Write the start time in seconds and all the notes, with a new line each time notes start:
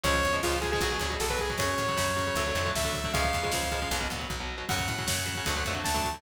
0.03 C#2 C#3 F3 G#3 C#5, kick, ride
0.14 kick
0.23 E2, kick, ride
0.33 C#3 F3 G#3, kick
0.43 C#2 C#3 F3 G#3 F4, kick, snare
0.53 kick
0.61 C#3 F3 G#3 G#4, kick, ride
0.72 C#3 F3 G#3 G#4, kick
0.81 B1 B2 F#3, kick, ride
0.91 B2 F#3, kick
1.00 D2 B2 F#3, kick, ride
1.10 B2 F#3, kick
1.20 B1 A4, kick, snare
1.30 B2 F#3 B4, kick
1.39 G#4, kick, ride
1.50 B2 F#3, kick
1.58 F#2 C#3 F#3 C#5, kick, ride
1.78 A2, kick, ride
1.88 C#3 F#3, kick
1.97 F#2 C#3 F#3, kick, snare
2.07 kick
2.16 C#3 F#3, kick, ride
2.27 C#3 F#3, kick
2.35 D2 D3 F#3 A3, kick, ride
2.46 D3 F#3 A3, kick
2.55 F2 D3 F#3 A3, kick, ride
2.66 D3 F#3 A3, kick
2.75 D2 E5, kick, snare
2.84 D3 F#3 A3, kick
2.94 kick, ride
3.04 D3 F#3 A3, kick
3.13 C#2 C#3 F3 G#3 F5, kick, ride
3.24 kick
3.33 E2, kick, ride
3.43 C#3 F3 G#3, kick
3.52 C#2 C#3 F3 G#3, kick, snare
3.63 kick
3.72 C#3 F3 G#3, kick, ride
3.82 C#3 F3 G#3, kick
3.91 B1 B2 F#3, kick, ride
4.00 B2 F#3, kick
4.10 D2 B2 F#3, kick, ride
4.19 B2 F#3, kick
4.30 B1, kick
4.40 B2 F#3
4.58 B2 F#3
4.69 F#2 C#3 F#3 F#5, kick, crash
4.79 kick
4.88 A2, kick, ride
4.98 C#3 F#3, kick
5.07 F#2 C#3 F#3, kick, snare
5.18 kick
5.26 C#3 F#3, kick, ride
5.35 C#3 F#3, kick
5.46 D2 D3 F#3 A3, kick, ride
5.56 D3 F#3 A3, kick
5.65 F2 D3 F#3 A3, kick, ride
5.75 D3 F#3 A3, kick
5.84 D2 A5, kick, snare
5.94 D3 F#3 A3, kick
6.04 kick, ride
6.13 D3 F#3 A3, kick